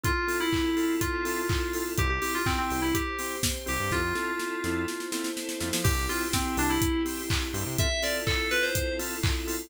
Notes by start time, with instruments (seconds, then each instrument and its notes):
0.04 drawbar organ C4 E4 F4 A4, pad 5 (bowed) C4 E4 F4 A4, electric piano 2 F4, kick, closed hi-hat
0.28 drawbar organ C4 E4 F4 A4, open hi-hat
0.40 electric piano 2 E4
0.53 kick, clap
0.76 drawbar organ C4 E4 F4 A4, open hi-hat
1.01 electric piano 2 F4, kick, closed hi-hat
1.25 drawbar organ C4 E4 F4 A4, open hi-hat
1.49 kick, clap
1.73 drawbar organ C4 E4 F4 A4, open hi-hat
1.98 synth bass 1 C2, drawbar organ C4 E4 G4, pad 5 (bowed) C4 E4 G4, electric piano 2 G4, kick, closed hi-hat
2.10 electric piano 2 G4
2.22 drawbar organ C4 E4 G4, electric piano 2 G4, open hi-hat
2.35 electric piano 2 F4
2.46 electric piano 2 C4, kick, clap
2.58 electric piano 2 C4
2.70 synth bass 1 C2, drawbar organ C4 E4 G4, open hi-hat
2.82 electric piano 2 E4
2.94 pad 5 (bowed) C4 G4 C5, electric piano 2 G4, kick, closed hi-hat
3.19 drawbar organ C4 E4 G4, open hi-hat
3.43 kick, snare
3.66 synth bass 1 C2, drawbar organ C4 E4 G4, electric piano 2 G4, open hi-hat
3.79 synth bass 1 G2
3.91 synth bass 1 F2, pad 5 (bowed) C4 E4 F4 A4, drawbar organ C4 E4 F4 A4, electric piano 2 F4, kick, snare
4.15 drawbar organ C4 E4 F4 A4, snare
4.40 snare
4.64 synth bass 1 F2, drawbar organ C4 E4 F4 A4, snare
4.88 pad 5 (bowed) C4 E4 A4 C5, snare
5.00 snare
5.12 drawbar organ C4 E4 F4 A4, snare
5.24 snare
5.37 snare
5.49 snare
5.60 synth bass 1 F2, drawbar organ C4 E4 F4 A4, snare
5.73 synth bass 1 F3, snare
5.84 synth bass 1 C2, pad 5 (bowed) C4 E4 G4, drawbar organ C4 E4 G4, electric piano 2 G4, kick, crash
6.09 drawbar organ C4 E4 G4, electric piano 2 F4, open hi-hat
6.33 electric piano 2 C4, kick, snare
6.57 synth bass 1 C2, drawbar organ C4 E4 G4, electric piano 2 D4, open hi-hat
6.70 electric piano 2 E4
6.82 kick, closed hi-hat
7.05 drawbar organ C4 E4 G4, open hi-hat
7.30 kick, clap
7.53 synth bass 1 G2, drawbar organ C4 E4 G4, open hi-hat
7.66 synth bass 1 C3
7.78 drawbar organ C4 E4 F4 A4, pad 5 (bowed) C4 E4 F4 A4, electric piano 2 E5, kick, closed hi-hat
8.03 drawbar organ C4 E4 F4 A4, electric piano 2 D5, open hi-hat
8.27 electric piano 2 A4, kick, clap
8.51 drawbar organ C4 E4 F4 A4, electric piano 2 B4, open hi-hat
8.63 electric piano 2 C5
8.75 kick, closed hi-hat
8.99 drawbar organ C4 E4 F4 A4, open hi-hat
9.23 kick, clap
9.47 drawbar organ C4 E4 F4 A4, open hi-hat